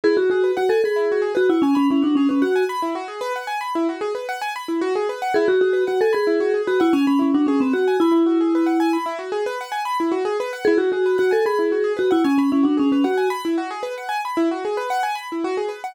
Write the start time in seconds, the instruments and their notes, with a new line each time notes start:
0.04 acoustic grand piano E4, vibraphone G#4
0.17 vibraphone F#4, acoustic grand piano F#4
0.30 vibraphone F#4, acoustic grand piano G#4
0.44 acoustic grand piano B4
0.57 vibraphone F#4, acoustic grand piano F#5
0.69 vibraphone A4, acoustic grand piano G#5
0.84 vibraphone G#4, acoustic grand piano B5
0.96 acoustic grand piano E4
1.12 acoustic grand piano F#4
1.22 acoustic grand piano G#4
1.35 vibraphone F#4, acoustic grand piano B4
1.49 vibraphone E4, acoustic grand piano F#5
1.62 vibraphone C#4, acoustic grand piano G#5
1.75 vibraphone C#4, acoustic grand piano B5
1.90 vibraphone C#4, acoustic grand piano E4
2.02 vibraphone D4, acoustic grand piano F#4
2.15 vibraphone C#4, acoustic grand piano G#4
2.29 vibraphone C#4, acoustic grand piano B4
2.42 vibraphone F#4, acoustic grand piano F#5
2.56 acoustic grand piano G#5
2.69 acoustic grand piano B5
2.82 acoustic grand piano E4
2.95 acoustic grand piano F#4
3.08 acoustic grand piano G#4
3.21 acoustic grand piano B4
3.36 acoustic grand piano F#5
3.47 acoustic grand piano G#5
3.61 acoustic grand piano B5
3.75 acoustic grand piano E4
3.89 acoustic grand piano F#4
4.01 acoustic grand piano G#4
4.15 acoustic grand piano B4
4.29 acoustic grand piano F#5
4.42 acoustic grand piano G#5
4.56 acoustic grand piano B5
4.68 acoustic grand piano E4
4.81 acoustic grand piano F#4
4.95 acoustic grand piano G#4
5.09 acoustic grand piano B4
5.22 acoustic grand piano F#5
5.34 acoustic grand piano E4, vibraphone G#4
5.48 vibraphone F#4, acoustic grand piano F#4
5.61 vibraphone F#4, acoustic grand piano G#4
5.73 acoustic grand piano B4
5.87 vibraphone F#4, acoustic grand piano F#5
6.01 vibraphone A4, acoustic grand piano G#5
6.13 vibraphone G#4, acoustic grand piano B5
6.27 acoustic grand piano E4
6.40 acoustic grand piano F#4
6.54 acoustic grand piano G#4
6.67 vibraphone F#4, acoustic grand piano B4
6.80 vibraphone E4, acoustic grand piano F#5
6.93 vibraphone C#4, acoustic grand piano G#5
7.07 vibraphone C#4, acoustic grand piano B5
7.19 vibraphone C#4, acoustic grand piano E4
7.34 vibraphone D4, acoustic grand piano F#4
7.47 vibraphone C#4, acoustic grand piano G#4
7.60 vibraphone C4, acoustic grand piano B4
7.73 vibraphone F#4, acoustic grand piano F#5
7.88 acoustic grand piano G#5
8.00 vibraphone E4, acoustic grand piano B5
8.12 acoustic grand piano E4
8.26 acoustic grand piano F#4
8.41 acoustic grand piano G#4
8.55 acoustic grand piano B4
8.66 acoustic grand piano F#5
8.80 acoustic grand piano G#5
8.93 acoustic grand piano B5
9.06 acoustic grand piano E4
9.19 acoustic grand piano F#4
9.32 acoustic grand piano G#4
9.46 acoustic grand piano B4
9.61 acoustic grand piano F#5
9.72 acoustic grand piano G#5
9.85 acoustic grand piano B5
10.00 acoustic grand piano E4
10.12 acoustic grand piano F#4
10.25 acoustic grand piano G#4
10.40 acoustic grand piano B4
10.53 acoustic grand piano F#5
10.65 acoustic grand piano E4, vibraphone G#4
10.78 vibraphone F#4, acoustic grand piano F#4
10.92 vibraphone F#4, acoustic grand piano G#4
11.06 acoustic grand piano B4
11.18 vibraphone F#4, acoustic grand piano F#5
11.31 vibraphone A4, acoustic grand piano G#5
11.45 vibraphone G#4, acoustic grand piano B5
11.59 acoustic grand piano E4
11.72 acoustic grand piano F#4
11.84 acoustic grand piano G#4
11.97 vibraphone F#4, acoustic grand piano B4
12.11 vibraphone E4, acoustic grand piano F#5
12.24 vibraphone C#4, acoustic grand piano G#5
12.38 vibraphone C#4, acoustic grand piano B5
12.52 vibraphone C#4, acoustic grand piano E4
12.63 vibraphone D4, acoustic grand piano F#4
12.77 vibraphone C#4, acoustic grand piano G#4
12.92 vibraphone C#4, acoustic grand piano B4
13.04 vibraphone F#4, acoustic grand piano F#5
13.17 acoustic grand piano G#5
13.30 acoustic grand piano B5
13.45 acoustic grand piano E4
13.58 acoustic grand piano F#4
13.71 acoustic grand piano G#4
13.83 acoustic grand piano B4
13.98 acoustic grand piano F#5
14.09 acoustic grand piano G#5
14.25 acoustic grand piano B5
14.37 acoustic grand piano E4
14.51 acoustic grand piano F#4
14.65 acoustic grand piano G#4
14.77 acoustic grand piano B4
14.90 acoustic grand piano F#5
15.03 acoustic grand piano G#5
15.15 acoustic grand piano B5
15.32 acoustic grand piano E4
15.44 acoustic grand piano F#4
15.57 acoustic grand piano G#4
15.69 acoustic grand piano B4
15.84 acoustic grand piano F#5